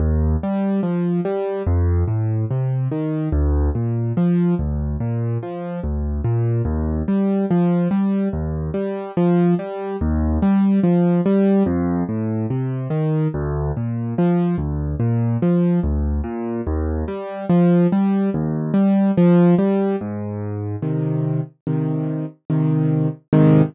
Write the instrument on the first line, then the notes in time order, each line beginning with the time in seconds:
acoustic grand piano
0.00 D#2
0.43 G3
0.83 F3
1.25 G3
1.66 F2
2.08 A2
2.51 C3
2.91 D#3
3.32 D2
3.75 A#2
4.17 F3
4.59 D2
5.00 A#2
5.43 F3
5.84 D2
6.24 A#2
6.65 D#2
7.08 G3
7.51 F3
7.91 G3
8.33 D#2
8.74 G3
9.17 F3
9.59 G3
10.01 D#2
10.42 G3
10.84 F3
11.26 G3
11.66 F2
12.09 A2
12.50 C3
12.90 D#3
13.34 D2
13.77 A#2
14.18 F3
14.58 D2
15.00 A#2
15.42 F3
15.84 D2
16.24 A#2
16.67 D#2
17.08 G3
17.49 F3
17.92 G3
18.34 D#2
18.74 G3
19.17 F3
19.59 G3
20.01 G#2
20.82 C3 D#3
21.67 C3 D#3
22.50 C3 D#3
23.33 G#2 C3 D#3